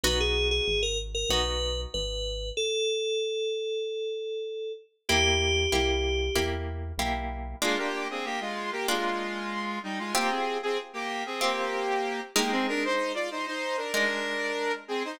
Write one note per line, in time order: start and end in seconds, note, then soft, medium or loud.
0.03 0.60 B1 medium
0.03 1.18 B3 loud
0.03 1.18 D#4 medium
0.03 1.18 F#4 medium
0.03 0.19 B4 medium
0.20 0.48 G#4 medium
0.51 0.82 G#4 medium
0.68 1.24 G#1 medium
0.83 0.98 A#4 medium
1.15 1.30 A#4 medium
1.29 1.86 B1 medium
1.29 2.44 B3 medium
1.29 2.44 D#4 medium
1.29 2.44 F#4 medium
1.29 1.81 B4 medium
1.94 2.51 G#1 medium
1.94 2.49 B4 medium
2.57 4.72 A4 medium
5.09 5.67 E2 medium
5.09 5.66 A#3 medium
5.09 5.66 E4 loud
5.09 6.43 G4 medium
5.09 5.66 G4 medium
5.72 6.30 C2 medium
5.72 6.29 A#3 medium
5.72 6.29 E4 medium
5.72 6.29 G4 medium
6.35 6.93 E2 medium
6.35 6.92 A#3 medium
6.35 6.92 E4 medium
6.35 6.92 G4 medium
6.98 7.54 B1 medium
6.98 7.56 A#3 medium
6.98 7.56 E4 medium
6.98 7.56 G4 medium
7.62 7.77 G#3 loud
7.62 8.76 A#3 loud
7.62 8.76 D4 loud
7.62 8.76 F4 loud
7.62 7.77 F4 loud
7.78 8.08 A#3 medium
7.78 8.08 G4 loud
8.10 8.25 C4 medium
8.10 8.25 G#4 medium
8.24 8.39 A#3 medium
8.24 8.39 G4 loud
8.40 8.71 G#3 medium
8.40 8.71 F4 medium
8.72 8.87 A#3 medium
8.72 8.87 G4 loud
8.88 9.79 G#3 medium
8.88 10.02 A#3 medium
8.88 10.02 D4 medium
8.88 10.02 F4 medium
8.88 9.79 F4 medium
9.83 9.98 G3 medium
9.83 9.98 D#4 medium
9.99 10.14 G#3 medium
9.99 10.14 F4 medium
10.15 10.30 A#3 medium
10.15 11.28 C4 loud
10.15 11.28 F4 medium
10.15 11.28 G4 loud
10.15 10.30 G4 loud
10.30 10.58 C4 medium
10.30 10.58 G#4 medium
10.63 10.78 C4 medium
10.63 10.78 G#4 loud
10.93 11.23 A#3 medium
10.93 11.23 G4 loud
11.26 11.41 C4 medium
11.26 11.41 G#4 medium
11.41 12.20 A#3 medium
11.41 12.31 C4 loud
11.41 12.31 F4 medium
11.41 12.31 G4 medium
11.41 12.20 G4 medium
12.36 13.81 G#3 loud
12.36 12.51 A#3 medium
12.36 13.81 D#4 loud
12.36 12.51 G4 medium
12.36 13.81 A#4 loud
12.51 12.66 C4 medium
12.51 12.66 G#4 loud
12.68 12.83 D4 loud
12.68 12.83 A#4 loud
12.84 13.12 D#4 medium
12.84 13.12 C5 medium
13.14 13.29 F4 medium
13.14 13.29 D5 medium
13.31 13.46 D#4 medium
13.31 13.46 C5 medium
13.46 13.76 D#4 medium
13.46 13.76 C5 medium
13.77 13.92 D4 medium
13.77 13.92 A#4 medium
13.93 15.08 G#3 medium
13.93 14.72 D4 medium
13.93 15.08 D#4 medium
13.93 14.72 A#4 loud
13.93 15.08 A#4 medium
14.88 15.03 C4 medium
14.88 15.03 G#4 medium
15.05 15.19 D#4 medium
15.05 15.19 C5 loud